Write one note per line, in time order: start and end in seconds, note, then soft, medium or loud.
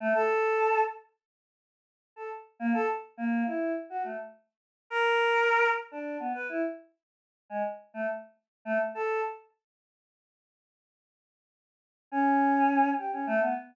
0.00 0.13 A3 loud
0.14 0.79 A4 loud
2.16 2.29 A4 medium
2.59 2.73 A#3 loud
2.74 2.87 A4 loud
3.17 3.43 A#3 loud
3.46 3.72 E4 medium
3.90 4.03 F#4 medium
4.04 4.17 A3 medium
4.90 5.68 A#4 loud
5.91 6.17 D4 medium
6.20 6.33 B3 medium
6.34 6.47 B4 medium
6.49 6.62 E4 medium
7.50 7.63 G#3 medium
7.94 8.07 A3 medium
8.65 8.78 A3 loud
8.95 9.21 A4 loud
12.12 12.89 C#4 loud
12.98 13.11 G4 medium
13.13 13.26 C#4 medium
13.27 13.40 A3 loud
13.41 13.54 B3 medium